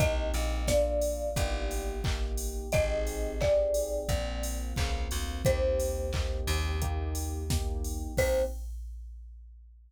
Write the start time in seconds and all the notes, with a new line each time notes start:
0.00 C2 A#3 C4 D#4 G4 D#5, kick, closed hi-hat
0.34 A#1, open hi-hat
0.68 A#3 D4 F4 D5, kick, snare
1.01 open hi-hat
1.36 G1 A#3 D#4 G4, kick, closed hi-hat
1.71 open hi-hat
2.04 A#3 D#4 G4, kick, clap
2.37 open hi-hat
2.72 G#1 C4 D#4 G4 G#4 D#5, kick, closed hi-hat
3.07 open hi-hat
3.41 C4 D#4 G4 G#4 D5, kick, clap
3.74 open hi-hat
4.09 A#1 A#3 C4 F4, kick, closed hi-hat
4.43 open hi-hat
4.76 C#2 A#3 C4 F4, kick, clap
5.11 D2, open hi-hat
5.45 D#2 A#3 C4 D#4 G4 C5, kick, closed hi-hat
5.80 open hi-hat
6.13 A#3 C4 D#4 G4, kick, clap
6.47 D#2, open hi-hat
6.82 A#3 D#4 G4, kick, closed hi-hat
7.15 open hi-hat
7.50 A#3 D#4 G4, kick, snare
7.85 open hi-hat
8.17 C2 A#3 C4 D#4 G4 C5, kick, crash